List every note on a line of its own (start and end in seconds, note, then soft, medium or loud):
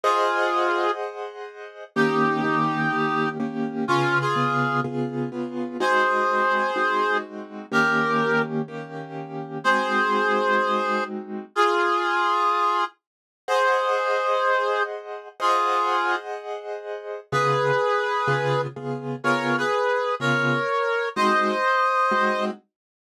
0.04 0.91 F4 medium
0.04 0.91 G#4 medium
0.04 1.84 G#4 medium
0.04 1.84 C5 medium
0.04 1.84 D#5 medium
0.04 1.84 F#5 medium
1.96 2.41 D#3 medium
1.96 2.41 A#3 medium
1.96 2.41 C#4 medium
1.96 3.29 D#4 medium
1.96 3.29 G4 medium
1.96 2.41 G4 medium
2.44 2.89 D#3 medium
2.44 2.89 A#3 medium
2.44 2.89 C#4 medium
2.44 2.89 G4 medium
2.93 3.38 D#3 medium
2.93 3.38 A#3 medium
2.93 3.38 C#4 medium
2.93 3.38 G4 medium
3.40 3.85 D#3 medium
3.40 3.85 A#3 medium
3.40 3.85 C#4 medium
3.40 3.85 G4 medium
3.88 4.34 C#3 medium
3.88 4.34 B3 medium
3.88 4.18 C#4 medium
3.88 4.18 F4 loud
3.88 4.34 F4 medium
3.88 4.34 G#4 medium
4.21 4.80 F4 medium
4.21 4.80 G#4 medium
4.36 4.81 C#3 medium
4.36 4.81 B3 medium
4.36 4.81 F4 medium
4.36 4.81 G#4 medium
4.84 5.29 C#3 medium
4.84 5.29 B3 medium
4.84 5.29 F4 medium
4.84 5.29 G#4 medium
5.32 5.77 C#3 medium
5.32 5.77 B3 medium
5.32 5.77 F4 medium
5.32 5.77 G#4 medium
5.80 6.71 G#3 medium
5.80 6.71 C4 medium
5.80 6.71 D#4 medium
5.80 6.71 F#4 medium
5.80 7.17 G#4 medium
5.80 7.17 C5 medium
6.76 7.66 G#3 medium
6.76 7.66 C4 medium
6.76 7.66 D#4 medium
6.76 7.66 F#4 medium
7.72 8.62 D#3 medium
7.72 8.62 A#3 medium
7.72 8.62 C#4 medium
7.72 8.62 G4 medium
7.72 8.42 G4 medium
7.72 8.42 A#4 loud
8.68 9.58 D#3 medium
8.68 9.58 A#3 medium
8.68 9.58 C#4 medium
8.68 9.58 G4 medium
9.64 11.45 G#3 medium
9.64 11.45 C4 medium
9.64 11.45 D#4 medium
9.64 11.45 F#4 medium
9.64 11.04 G#4 medium
9.64 11.04 C5 loud
11.55 12.84 F4 medium
11.55 12.84 G#4 loud
13.48 15.28 G#4 medium
13.48 14.83 G#4 medium
13.48 15.28 C5 medium
13.48 14.83 C5 medium
13.48 15.28 D#5 medium
13.48 15.28 F#5 medium
15.40 16.16 F4 medium
15.40 17.20 G#4 medium
15.40 16.16 G#4 loud
15.40 17.20 C5 medium
15.40 17.20 D#5 medium
15.40 17.20 F#5 medium
17.32 17.72 C#3 medium
17.32 17.72 B3 medium
17.32 17.72 F4 medium
17.32 18.61 G#4 medium
17.32 17.72 G#4 medium
17.32 18.61 B4 medium
18.28 18.67 C#3 medium
18.28 18.67 B3 medium
18.28 18.67 F4 medium
18.28 18.67 G#4 medium
18.76 19.16 C#3 medium
18.76 19.16 B3 medium
18.76 19.16 F4 medium
18.76 19.16 G#4 medium
19.24 19.63 C#3 medium
19.24 19.63 B3 medium
19.24 19.63 F4 medium
19.24 19.63 G#4 medium
19.24 19.56 A#4 medium
19.24 19.56 C#5 medium
19.58 20.15 G#4 medium
19.58 20.15 B4 medium
20.20 20.59 C#3 medium
20.20 20.59 B3 medium
20.20 20.59 F4 medium
20.20 20.59 G#4 medium
20.20 21.09 A#4 medium
20.20 21.09 C#5 medium
21.16 21.56 G#3 loud
21.16 21.56 C4 medium
21.16 21.56 D#4 loud
21.16 21.56 F#4 medium
21.16 22.45 C5 medium
21.16 22.45 D#5 loud
22.11 22.51 G#3 medium
22.11 22.51 C4 medium
22.11 22.51 D#4 medium
22.11 22.51 F#4 medium